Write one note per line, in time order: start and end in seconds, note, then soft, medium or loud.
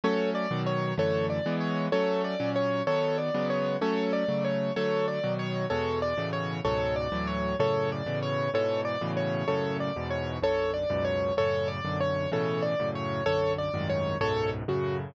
0.04 0.46 F#3 loud
0.04 0.46 A3 loud
0.04 0.46 C#4 loud
0.04 0.30 A4 medium
0.04 0.30 C#5 medium
0.35 0.62 D5 medium
0.51 0.93 B2 loud
0.51 0.93 D#3 loud
0.51 0.93 F#3 loud
0.66 0.94 C#5 medium
0.97 1.40 F#2 loud
0.97 1.40 D3 loud
0.97 1.40 E3 loud
0.97 1.40 A3 loud
0.97 1.26 A4 medium
0.97 1.26 C#5 medium
1.30 1.56 D5 medium
1.46 1.88 E3 loud
1.46 1.88 G#3 loud
1.46 1.88 B3 loud
1.60 1.86 C#5 medium
1.92 2.35 F#3 loud
1.92 2.35 A3 loud
1.92 2.35 C#4 loud
1.92 2.22 A4 medium
1.92 2.22 C#5 medium
2.24 2.50 D5 medium
2.40 2.82 A#2 loud
2.40 2.82 F#3 loud
2.40 2.82 C#4 loud
2.56 2.83 C#5 medium
2.87 3.30 D#3 loud
2.87 3.30 F#3 loud
2.87 3.30 B3 loud
2.87 3.17 A4 medium
2.87 3.17 C#5 medium
3.18 3.47 D5 medium
3.34 3.77 C#3 loud
3.34 3.77 F#3 loud
3.34 3.77 G#3 loud
3.34 3.77 B3 loud
3.50 3.76 C#5 medium
3.81 4.24 F#3 loud
3.81 4.24 A3 loud
3.81 4.24 C#4 loud
3.81 4.12 A4 medium
3.81 4.12 C#5 medium
4.13 4.44 D5 medium
4.28 4.71 C#3 loud
4.28 4.71 F#3 loud
4.28 4.71 A3 loud
4.44 4.73 C#5 medium
4.76 5.19 D3 loud
4.76 5.19 F#3 loud
4.76 5.19 A3 loud
4.76 5.06 A4 medium
4.76 5.06 C#5 medium
5.08 5.33 D5 medium
5.24 5.66 B2 loud
5.24 5.66 D#3 loud
5.24 5.66 F#3 loud
5.39 5.65 C#5 medium
5.70 6.13 E2 loud
5.70 6.13 B2 loud
5.70 6.13 G#3 loud
5.70 5.99 A4 medium
5.70 5.99 C#5 medium
6.02 6.29 D5 medium
6.17 6.60 A2 loud
6.17 6.60 B2 loud
6.17 6.60 C#3 loud
6.17 6.60 E3 loud
6.33 6.60 C#5 medium
6.65 7.08 C#2 loud
6.65 7.08 G#2 loud
6.65 7.08 B2 loud
6.65 7.08 F#3 loud
6.65 6.95 A4 medium
6.65 6.95 C#5 medium
6.96 7.26 D5 medium
7.12 7.54 D2 loud
7.12 7.54 A2 loud
7.12 7.54 E3 loud
7.12 7.54 F#3 loud
7.27 7.56 C#5 medium
7.59 8.02 F#2 loud
7.59 8.02 A2 loud
7.59 8.02 C#3 loud
7.59 7.90 A4 medium
7.59 7.90 C#5 medium
7.92 8.19 D5 medium
8.06 8.49 A2 medium
8.06 8.49 B2 loud
8.06 8.49 C#3 loud
8.06 8.49 E3 loud
8.23 8.50 C#5 medium
8.54 8.96 G#2 loud
8.54 8.96 B2 loud
8.54 8.96 E3 loud
8.54 8.81 A4 medium
8.54 8.81 C#5 medium
8.85 9.11 D5 medium
9.01 9.44 A2 loud
9.01 9.44 B2 loud
9.01 9.44 C#3 loud
9.01 9.44 E3 loud
9.17 9.47 C#5 medium
9.48 9.91 F#2 loud
9.48 9.91 A2 loud
9.48 9.91 C#3 loud
9.48 9.77 A4 medium
9.48 9.77 C#5 medium
9.80 10.08 D5 medium
9.96 10.39 E2 loud
9.96 10.39 G#2 loud
9.96 10.39 B2 loud
10.10 10.37 C#5 medium
10.42 10.85 B1 medium
10.42 10.85 F#2 loud
10.42 10.85 D3 loud
10.42 10.71 A4 medium
10.42 10.71 C#5 medium
10.74 11.03 D5 medium
10.90 11.32 C#2 loud
10.90 11.32 F#2 loud
10.90 11.32 G#2 loud
10.90 11.32 B2 loud
11.05 11.34 C#5 medium
11.37 11.80 F#2 loud
11.37 11.80 A2 loud
11.37 11.80 C#3 loud
11.37 11.68 A4 medium
11.37 11.68 C#5 medium
11.68 11.98 D5 medium
11.85 12.27 B1 loud
11.85 12.27 F#2 loud
11.85 12.27 D3 loud
12.00 12.30 C#5 medium
12.32 12.74 A2 loud
12.32 12.74 B2 loud
12.32 12.74 C#3 loud
12.32 12.74 E3 loud
12.32 12.63 A4 medium
12.32 12.63 C#5 medium
12.62 12.89 D5 medium
12.79 13.22 F#2 loud
12.79 13.22 A2 loud
12.79 13.22 C#3 loud
12.95 13.24 C#5 medium
13.26 13.69 B1 loud
13.26 13.69 F#2 loud
13.26 13.69 D3 loud
13.26 13.53 A4 medium
13.26 13.53 C#5 medium
13.58 13.88 D5 medium
13.74 14.16 C2 loud
13.74 14.16 F#2 loud
13.74 14.16 G#2 loud
13.74 14.16 D#3 loud
13.90 14.17 C#5 medium
14.21 14.63 C#2 loud
14.21 14.63 F#2 loud
14.21 14.63 G#2 loud
14.21 14.63 B2 loud
14.21 14.49 A4 medium
14.21 14.49 C#5 medium
14.68 15.11 F#2 loud
14.68 15.11 A2 loud
14.68 15.11 C#3 loud
14.68 14.97 F#4 medium